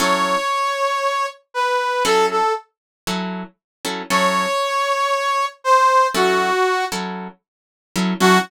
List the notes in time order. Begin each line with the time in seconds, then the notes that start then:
0.00 F#3 C#4 E4 A4 C#5
1.54 B4
2.05 F#3 C#4 E4 A4
2.31 A4
3.07 F#3 C#4 E4 A4
3.85 F#3 C#4 E4 A4
4.10 F#3 C#4 E4 A4 C#5
5.64 C5
6.15 F#3 C#4 E4 F#4 A4
6.92 F#3 C#4 E4 A4
7.96 F#3 C#4 E4 A4
8.20 F#3 C#4 E4 F#4 A4